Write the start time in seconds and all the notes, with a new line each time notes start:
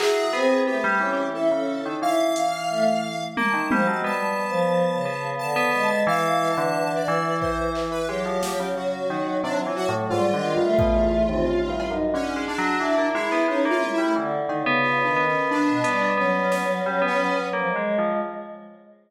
0.00 F#3 E4 G#4, clap
0.33 B3 C4
0.67 A3 B3 G4, cowbell
0.84 G3
1.00 E3 C#4
1.35 E4 A4
1.52 C#3 C#4
1.86 D#3
2.02 E3 E4 F5
2.36 closed hi-hat
2.70 A3
3.37 A#3 A5, high tom
3.54 D#3
3.71 F3 G3, high tom
3.87 F#3 G#3
4.04 G3 B3 A5
4.49 F3
4.95 C#3
5.05 B3
5.39 D3 A5
5.56 B3
5.73 G#3
5.91 B3
6.07 E3 F5
6.51 A5
6.57 D3
6.96 D5
7.08 E3
7.41 C5, kick
7.75 clap
7.92 B4
8.08 F#3 G#3 G4
8.26 F3
8.43 snare
8.60 C#3
8.77 F#4
9.10 D#3
9.44 C3 D4
9.62 F4
9.66 E3
9.76 F#4, cowbell
9.89 A2
10.10 G#2 G3 F4
10.28 D#3
10.34 D3
10.57 G2
10.61 A3
10.79 B2, kick
10.96 E2
11.29 D#2 C4
11.45 D#2 C#4
11.68 G2 E4
11.80 cowbell
11.90 F#2 D#4
12.14 D3 C#4
12.36 G#3
12.48 D4
12.58 F#3
12.80 E3 E4
12.98 A#3
13.03 E4
13.14 G#3 E4
13.26 E4
13.32 B3
13.48 G#3 C#4 D#4
13.65 A#3 E4
13.70 F4
13.82 E4, high tom
13.94 E4
13.98 G3 A3
14.16 D3 E3
14.49 D#3, cowbell
14.60 C#3
14.66 B3
14.83 F4
15.04 D#3 D4
15.16 B3
15.28 C#4
15.51 D4
15.68 B2
15.84 G3 B3, closed hi-hat
16.17 F#3 B3 C#4
16.52 B3, snare
16.63 C#4
16.86 G3
17.02 B3
17.07 C#4
17.36 B3
17.53 F3 A#3
17.69 G#3
17.76 G#3
17.98 F3